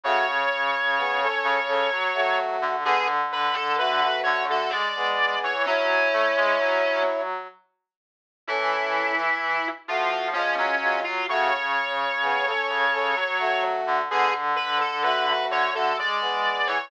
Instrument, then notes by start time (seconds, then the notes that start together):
brass section
0.04 C#3 A3 F#4 C#5
0.98 B3 G#4
1.21 C#4 A4
1.44 C#3
1.68 C#4 A4
1.91 F#3
2.14 A3 F#4
2.62 D3
2.85 D3 B3 G#4
3.32 B4
3.54 A4
3.78 A3 F#4 B4
4.02 A3 F#4
4.23 D3 C#5
4.49 A3 F#4 A4
4.70 G#3 D5
4.96 B3 G#4
5.43 E3 C#5
5.66 F#3 C#4 E4 C#5
6.13 A3
6.37 G#3
6.60 F#3
8.47 E3 C#4 E4 A4
9.88 F3 A3 F4 F#4
10.12 F3
10.33 F3 G#3 C#4 F4
10.57 F#3 C#4
10.82 G#3 F4
11.04 F4
11.28 C#3 A3 F#4 C#5
12.22 B3 G#4
12.46 C#4 A4
12.69 C#3
12.92 C#4 A4
13.16 F#3
13.39 A3 F#4
13.87 D3
14.10 D3 B3 G#4
14.56 B4
14.80 A4
15.03 A3 F#4 B4
15.27 A3 F#4
15.50 D3 C#5
15.74 A3 F#4 A4
15.98 G#3 D5
16.21 B3 G#4
16.67 E3 C#5